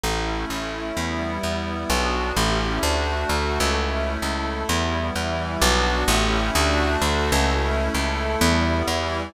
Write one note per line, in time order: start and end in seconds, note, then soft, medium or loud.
0.03 0.45 A1 medium
0.03 0.98 A3 medium
0.03 0.98 C#4 medium
0.03 0.96 E4 medium
0.50 0.92 A1 medium
0.97 1.39 E2 medium
0.97 1.89 G3 medium
0.97 1.89 B3 medium
0.97 1.89 E4 medium
1.43 1.85 E2 medium
1.90 2.32 B1 loud
1.90 2.36 B3 medium
1.90 2.36 D4 medium
1.90 2.36 F#4 loud
2.36 2.79 A1 loud
2.36 2.81 A3 medium
2.36 2.83 C#4 medium
2.36 2.83 E4 medium
2.36 2.83 G4 medium
2.82 3.25 D2 loud
2.82 3.27 A3 loud
2.82 3.28 D4 loud
2.82 3.27 F#4 medium
3.28 3.59 D2 medium
3.28 3.74 A3 loud
3.28 3.74 F#4 loud
3.28 3.74 A4 medium
3.60 4.17 C#2 loud
3.76 4.21 A3 medium
3.76 4.22 C#4 medium
3.76 4.21 E4 medium
4.21 4.64 C#2 medium
4.21 4.67 A3 medium
4.21 4.67 E4 medium
4.21 4.67 A4 medium
4.68 5.11 E2 loud
4.68 5.14 G3 medium
4.68 5.14 B3 medium
4.68 5.14 E4 medium
5.16 5.57 E2 medium
5.16 5.62 E3 medium
5.16 5.62 G3 medium
5.16 5.62 E4 medium
5.61 6.04 B1 loud
5.61 6.08 B3 loud
5.61 6.08 D4 loud
5.61 6.08 F#4 loud
6.08 6.51 A1 loud
6.08 6.53 A3 loud
6.08 6.56 C#4 loud
6.08 6.56 E4 loud
6.08 6.56 G4 loud
6.53 6.97 D2 loud
6.53 6.99 A3 loud
6.53 6.99 D4 loud
6.53 6.99 F#4 loud
7.01 7.31 D2 loud
7.01 7.47 A3 loud
7.01 7.47 F#4 loud
7.01 7.47 A4 loud
7.32 7.89 C#2 loud
7.48 7.94 A3 loud
7.48 7.94 C#4 loud
7.48 7.94 E4 loud
7.94 8.36 C#2 medium
7.94 8.40 A3 loud
7.94 8.39 E4 loud
7.94 8.40 A4 medium
8.39 8.83 E2 loud
8.39 8.85 G3 loud
8.39 8.85 B3 medium
8.39 8.85 E4 loud
8.87 9.29 E2 medium
8.87 9.33 E3 loud
8.87 9.33 G3 loud
8.87 9.33 E4 loud